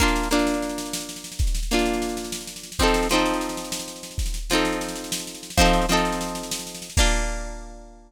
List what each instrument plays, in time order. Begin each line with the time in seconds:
0.00 pizzicato strings A#3 D4 F4, kick, snare
0.08 snare
0.16 snare
0.23 snare
0.31 pizzicato strings A#3 D4 F4, snare
0.39 snare
0.47 snare
0.54 snare
0.62 snare
0.69 snare
0.78 snare
0.86 snare
0.93 snare
1.00 snare
1.09 snare
1.16 snare
1.24 snare
1.32 snare
1.39 kick, snare
1.47 snare
1.55 snare
1.63 snare
1.71 pizzicato strings A#3 D4 F4, snare
1.79 snare
1.86 snare
1.93 snare
2.02 snare
2.09 snare
2.17 snare
2.24 snare
2.32 snare
2.41 snare
2.47 snare
2.56 snare
2.63 snare
2.72 snare
2.79 pizzicato strings F3 C4 D#4, kick, snare
2.83 pizzicato strings A4
2.87 snare
2.94 snare
3.03 snare
3.09 pizzicato strings F3 C4 D#4, snare
3.15 pizzicato strings A4, snare
3.26 snare
3.34 snare
3.41 snare
3.49 snare
3.57 snare
3.64 snare
3.72 snare
3.80 snare
3.88 snare
3.96 snare
4.03 snare
4.11 snare
4.18 kick, snare
4.26 snare
4.34 snare
4.50 pizzicato strings F3 C4 D#4, snare
4.55 pizzicato strings A4, snare
4.65 snare
4.72 snare
4.81 snare
4.88 snare
4.96 snare
5.04 snare
5.12 snare
5.19 snare
5.27 snare
5.34 snare
5.43 snare
5.50 snare
5.57 pizzicato strings F3 C4 D#4, kick, snare
5.61 pizzicato strings A4, snare
5.73 snare
5.82 snare
5.89 pizzicato strings F3 C4 D#4, snare
5.93 pizzicato strings A4, snare
6.05 snare
6.12 snare
6.21 snare
6.28 snare
6.35 snare
6.43 snare
6.51 snare
6.59 snare
6.67 snare
6.75 snare
6.82 snare
6.90 snare
6.97 pizzicato strings A#3 D4 F4, kick, crash